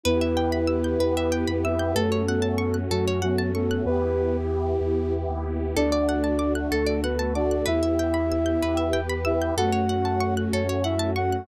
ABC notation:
X:1
M:6/8
L:1/16
Q:3/8=63
K:D
V:1 name="Ocarina"
[B,B]10 [Ee]2 | [A,A]6 [F,F]2 [F,F]2 [A,A]2 | [B,B]4 z8 | [Dd]6 [A,A]2 [B,B]2 [Dd]2 |
[Ee]10 [Ee]2 | [Ff]6 [Cc]2 [Ee]2 [Ff]2 |]
V:2 name="Flute"
E12 | A,2 B,4 z2 B,2 B,2 | G10 z2 | D10 F2 |
E8 z4 | A,8 z4 |]
V:3 name="Pizzicato Strings"
B e g b e' g' B e g b e' g' | A c f a c' f' A c f a c' f' | z12 | A d f a d' f' A d f a d' f' |
B e g b e' g' B e g b e' g' | A c f a c' f' A c f a c' f' |]
V:4 name="Synth Bass 2" clef=bass
E,,6 E,,3 =F,,3 | F,,6 F,,6 | E,,6 E,,3 ^D,,3 | D,,6 D,,6 |
E,,6 E,,6 | F,,6 F,,6 |]
V:5 name="Pad 2 (warm)"
[B,EG]6 [B,GB]6 | [A,CF]12 | [B,EG]12 | [A,DF]6 [A,FA]6 |
[B,EG]6 [B,GB]6 | [A,CF]12 |]